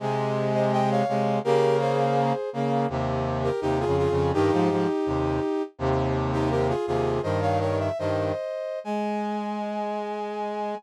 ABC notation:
X:1
M:2/4
L:1/16
Q:1/4=83
K:Ab
V:1 name="Brass Section"
z3 [ce] [eg] [df] [df]2 | [GB]2 [Ac]4 z2 | z3 [GB] [EG] [FA] [FA]2 | [EG]8 |
z3 [EG] [GB] [FA] [FA]2 | "^rit." [ce] [df] [Bd] _f [ce]4 | a8 |]
V:2 name="Brass Section"
[C,A,]6 [C,A,]2 | [D,B,]6 [D,B,]2 | [E,,C,]4 (3[E,,C,]2 [F,,D,]2 [F,,D,]2 | [G,,E,] [A,,F,] [A,,F,] z [E,,C,]2 z2 |
[E,,C,]6 [E,,C,]2 | "^rit." [G,,E,]4 [G,,E,]2 z2 | A,8 |]